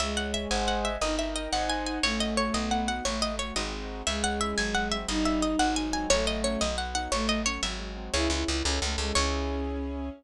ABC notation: X:1
M:6/8
L:1/8
Q:3/8=118
K:C#m
V:1 name="Harpsichord"
e f e g f e | d e d f g g | c d c d f f | c d c d2 z |
e f e g f e | d e d f g g | c d c d f f | c d c e2 z |
c4 z2 | c6 |]
V:2 name="Violin"
G,6 | D6 | A,6 | A,2 z4 |
G,6 | D6 | A,3 z3 | A,2 z4 |
E E E C A, G, | C6 |]
V:3 name="Acoustic Grand Piano"
c e g [^Bdfg]3 | ^A d =g [^Bdf^g]3 | C F A B, D F | A, F A, [G,^B,DF]3 |
G, C E F, G, ^B, | =G, D G, F, ^G, ^B, | F, A, C F, B, D | F, A, C F, G, ^B, |
[CEG]3 [CEA]3 | [CEG]6 |]
V:4 name="Electric Bass (finger)" clef=bass
C,,3 G,,,3 | =G,,,3 ^G,,,3 | A,,,3 B,,,3 | A,,,3 G,,,3 |
C,,3 G,,,3 | =G,,,3 ^G,,,3 | A,,,3 B,,,3 | A,,,3 G,,,3 |
C,, C,, C,, C,, C,, C,, | C,,6 |]